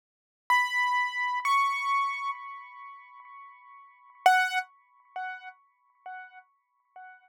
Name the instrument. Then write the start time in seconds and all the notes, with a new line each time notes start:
acoustic grand piano
0.50 B5
1.45 C#6
4.26 F#5